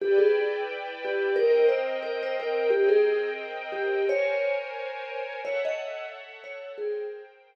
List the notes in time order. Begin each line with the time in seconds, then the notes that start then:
0.00 E4 G4 B4 D5 G5
0.18 G#4
1.05 G4
1.36 C4 A#4 D#5 G5
1.69 C5
2.03 A#4
2.23 C5
2.40 A#4
2.70 C4 G4 A#4 D#5 G5
2.89 G#4
3.72 G4
4.06 A#4 C5 C#5 G#5
5.43 A4 C#5 E5 F#5
5.65 D#5
6.44 C#5
6.78 G#4 A#4 C5 G5